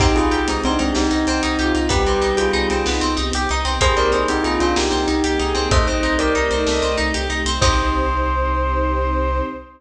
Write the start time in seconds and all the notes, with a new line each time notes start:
0.00 C2 C4 D#4 G4, kick, crash
0.15 C2 D#4 F4 G#4, closed hi-hat
0.31 C2 D#4 G4, closed hi-hat
0.47 C2 G#3 C4 D#4, closed hi-hat
0.64 C2 C4 D4 D#4, closed hi-hat
0.79 C2 G#3 C4 D#4, closed hi-hat
0.95 C2 C4 D#4 G4, snare
1.11 C2 D#4, closed hi-hat
1.27 C2 C4, closed hi-hat
1.43 C2 D#4, closed hi-hat
1.59 C2 F4 G4, closed hi-hat
1.75 C2 D#4, closed hi-hat
1.89 C2 G3 B3 C4 D#4 G4 B4, kick, closed hi-hat
2.06 C2 C4, closed hi-hat
2.22 C2 D#4, closed hi-hat
2.37 C2 F4 G4 G#4, closed hi-hat
2.53 C2 D#4, closed hi-hat
2.70 C2 C4, closed hi-hat
2.86 C2 B3 D#4, snare
3.01 C2 C4, closed hi-hat
3.17 C2 D#4, closed hi-hat
3.33 C2 G4, closed hi-hat
3.49 C2 D#4, closed hi-hat
3.65 C2 C4, closed hi-hat
3.80 C2 A#3 C4 D#4 G4 G#4 C5, kick, closed hi-hat
3.97 C2 C4 A#4 D5, closed hi-hat
4.12 C2 D#4 G#4 C5, closed hi-hat
4.28 C2 C4 D#4 G4, closed hi-hat
4.44 C2 D#4 F4 G#4, closed hi-hat
4.60 C2 C4 D4 F4, closed hi-hat
4.76 C2 A#3 D#4 G4, snare
4.91 C2 C4, closed hi-hat
5.07 C2 D#4, closed hi-hat
5.24 C2 G4, closed hi-hat
5.39 C2 D#4 G#4, closed hi-hat
5.55 C2 C4, closed hi-hat
5.71 C2 A3 C4 D#4 G4 C5 D#5, kick, closed hi-hat
5.87 C2 C4 C5 D#5, closed hi-hat
6.03 C2 D#4, closed hi-hat
6.19 C2 G4 A#4 D5, closed hi-hat
6.35 C2 D#4, closed hi-hat
6.50 C2 C4 D#4, closed hi-hat
6.67 C2 A3 D#5, snare
6.82 C2 C4, closed hi-hat
6.97 C2 D#4, closed hi-hat
7.14 C2 G4, closed hi-hat
7.30 C2 D#4, closed hi-hat
7.45 C2 C4, closed hi-hat
7.61 C2 C4 D#4 G4 C5, kick, crash